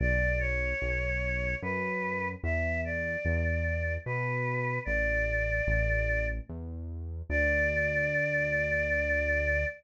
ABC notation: X:1
M:3/4
L:1/8
Q:1/4=74
K:D
V:1 name="Choir Aahs"
d c3 B2 | e d3 B2 | d4 z2 | d6 |]
V:2 name="Synth Bass 1" clef=bass
B,,,2 B,,,2 F,,2 | E,,2 E,,2 B,,2 | A,,,2 A,,,2 E,,2 | D,,6 |]